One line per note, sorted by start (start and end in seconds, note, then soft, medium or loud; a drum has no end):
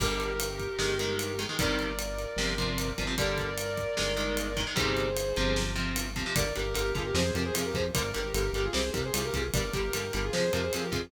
0.00 0.68 G1 medium
0.00 0.31 D3 loud
0.00 0.31 G3 loud
0.00 1.40 G4 loud
0.00 1.40 A#4 loud
0.00 kick medium
0.00 crash medium
0.20 ride medium
0.40 ride loud
0.60 kick medium
0.60 ride soft
0.79 1.46 G1 medium
0.79 0.94 D#3 loud
0.79 0.94 G#3 medium
0.79 snare medium
0.99 1.31 D#3 medium
0.99 1.31 G#3 medium
0.99 ride medium
1.19 ride medium
1.39 1.47 D#3 medium
1.39 1.47 G#3 medium
1.39 ride medium
1.49 1.57 D#3 medium
1.49 1.57 G#3 medium
1.59 2.26 G1 medium
1.59 1.91 C3 medium
1.59 1.91 D#3 medium
1.59 1.91 G3 medium
1.59 3.03 A#4 medium
1.59 3.03 D5 loud
1.59 kick medium
1.59 ride medium
1.79 ride medium
1.99 ride medium
2.19 ride medium
2.37 2.93 G1 medium
2.37 2.54 C3 loud
2.37 2.54 F3 loud
2.37 snare medium
2.58 2.90 C3 medium
2.58 2.90 F3 medium
2.58 kick medium
2.58 ride medium
2.78 ride medium
2.98 3.86 G1 medium
2.98 3.06 C3 medium
2.98 3.06 F3 medium
2.98 kick medium
2.98 ride medium
3.07 3.15 C3 medium
3.07 3.15 F3 medium
3.18 3.50 D3 loud
3.18 3.50 G3 loud
3.18 4.59 A#4 loud
3.18 4.59 D5 loud
3.18 kick medium
3.18 ride medium
3.38 kick medium
3.38 ride medium
3.58 ride medium
3.77 kick medium
3.77 ride medium
3.97 4.66 G1 medium
3.97 4.13 D#3 medium
3.97 4.13 G#3 medium
3.97 snare medium
4.16 4.48 D#3 medium
4.16 4.48 G#3 medium
4.16 ride medium
4.37 ride medium
4.57 4.65 D#3 medium
4.57 4.65 G#3 medium
4.57 kick medium
4.57 ride medium
4.67 4.75 D#3 medium
4.67 4.75 G#3 medium
4.76 5.33 G1 medium
4.76 5.08 C3 loud
4.76 5.08 D#3 loud
4.76 5.08 G3 loud
4.76 5.62 G#4 medium
4.76 5.62 C5 loud
4.76 kick medium
4.76 ride medium
4.97 ride medium
5.17 ride medium
5.36 6.25 G1 medium
5.36 5.73 C3 medium
5.36 5.73 F3 loud
5.36 ride medium
5.56 snare medium
5.75 6.07 C3 medium
5.75 6.07 F3 medium
5.75 ride medium
5.96 ride medium
6.16 6.24 C3 medium
6.16 6.24 F3 medium
6.16 kick medium
6.16 ride medium
6.26 6.34 C3 medium
6.26 6.34 F3 medium
6.35 6.52 G1 medium
6.35 6.44 D3 medium
6.35 6.44 G3 medium
6.35 6.53 A#4 medium
6.35 6.53 D5 loud
6.35 kick medium
6.35 ride loud
6.55 6.74 G1 medium
6.55 6.63 D3 medium
6.55 6.63 G3 medium
6.55 6.74 G4 medium
6.55 6.74 A#4 loud
6.55 ride medium
6.74 6.93 G1 medium
6.74 6.82 D3 medium
6.74 6.82 G3 medium
6.74 6.91 G4 loud
6.74 6.91 A#4 loud
6.74 ride medium
6.95 7.12 G1 medium
6.95 7.03 D3 medium
6.95 7.03 G3 medium
6.95 7.05 F4 medium
6.95 7.05 G#4 loud
6.95 kick medium
6.95 ride medium
7.05 7.15 G4 medium
7.05 7.15 A#4 loud
7.14 7.31 F2 loud
7.14 7.23 C3 medium
7.14 7.23 F3 medium
7.14 7.33 G#4 loud
7.14 7.33 C5 loud
7.14 snare loud
7.34 7.51 F2 medium
7.34 7.44 C3 medium
7.34 7.44 F3 medium
7.34 7.43 G4 medium
7.34 7.43 A#4 loud
7.34 ride medium
7.45 7.54 G#4 loud
7.45 7.54 C5 loud
7.54 7.73 F2 medium
7.54 7.62 C3 medium
7.54 7.62 F3 medium
7.54 7.65 F4 loud
7.54 7.65 G#4 loud
7.54 ride loud
7.65 7.75 G4 medium
7.65 7.75 A#4 loud
7.74 7.91 F2 medium
7.74 7.83 C3 medium
7.74 7.83 F3 medium
7.74 7.84 G#4 loud
7.74 7.84 C5 loud
7.74 kick medium
7.74 ride medium
7.94 8.13 G1 medium
7.94 8.03 D3 medium
7.94 8.03 G3 medium
7.94 8.10 A#4 loud
7.94 8.10 D5 loud
7.94 kick medium
7.94 ride medium
8.14 8.33 G1 medium
8.14 8.22 D3 medium
8.14 8.22 G3 medium
8.14 8.33 G4 loud
8.14 8.33 A#4 loud
8.14 ride medium
8.34 8.50 G1 medium
8.34 8.43 D3 medium
8.34 8.43 G3 medium
8.34 8.50 G4 medium
8.34 8.50 A#4 loud
8.34 ride medium
8.53 8.69 G1 medium
8.53 8.63 D3 medium
8.53 8.63 G3 medium
8.53 8.64 G4 medium
8.53 8.64 A#4 loud
8.53 ride medium
8.64 8.74 F4 medium
8.64 8.73 G#4 loud
8.73 8.91 C2 medium
8.73 8.81 C3 medium
8.73 8.81 G3 medium
8.73 8.90 G#4 loud
8.73 8.90 C5 loud
8.73 snare loud
8.93 9.11 C2 medium
8.93 9.02 C3 medium
8.93 9.02 G3 medium
8.93 9.02 G4 medium
8.93 9.02 A#4 loud
8.93 kick medium
8.93 ride medium
9.05 9.13 G#4 loud
9.05 9.14 C5 loud
9.14 9.31 C2 medium
9.14 9.22 C3 medium
9.14 9.22 G3 medium
9.14 9.23 F4 medium
9.14 9.23 G#4 medium
9.14 ride loud
9.24 9.34 G4 loud
9.24 9.34 A#4 loud
9.34 9.50 C2 medium
9.34 9.42 C3 medium
9.34 9.42 G3 medium
9.34 9.45 F4 medium
9.34 9.45 G#4 loud
9.34 kick medium
9.34 ride medium
9.54 9.71 G1 medium
9.54 9.63 D3 medium
9.54 9.63 G3 medium
9.54 9.71 A#4 medium
9.54 9.71 D5 loud
9.54 kick medium
9.54 ride medium
9.73 9.90 G1 medium
9.73 9.82 D3 medium
9.73 9.82 G3 medium
9.73 9.92 G4 medium
9.73 9.92 A#4 loud
9.73 kick medium
9.73 ride medium
9.93 10.11 G1 medium
9.93 10.02 D3 medium
9.93 10.02 G3 medium
9.93 10.12 G4 medium
9.93 10.12 A#4 loud
9.93 ride medium
10.13 10.31 G1 medium
10.13 10.21 D3 medium
10.13 10.21 G3 medium
10.13 10.24 G4 medium
10.13 10.24 A#4 loud
10.13 ride medium
10.24 10.33 F4 medium
10.24 10.32 G#4 loud
10.33 10.50 F2 medium
10.33 10.42 C3 medium
10.33 10.42 F3 medium
10.33 10.52 G#4 loud
10.33 10.52 C5 loud
10.33 snare medium
10.53 10.70 F2 medium
10.53 10.61 C3 medium
10.53 10.61 F3 medium
10.53 10.63 G4 medium
10.53 10.63 A#4 loud
10.53 ride medium
10.63 10.72 G#4 medium
10.63 10.72 C5 loud
10.73 10.91 F2 medium
10.73 10.82 C3 medium
10.73 10.82 F3 medium
10.73 10.83 F4 medium
10.73 10.83 G#4 medium
10.73 ride medium
10.84 10.93 G4 medium
10.84 10.93 A#4 loud
10.92 11.09 F2 medium
10.92 11.00 C3 medium
10.92 11.00 F3 medium
10.92 11.02 F4 loud
10.92 11.02 G#4 loud
10.92 kick medium
10.92 ride medium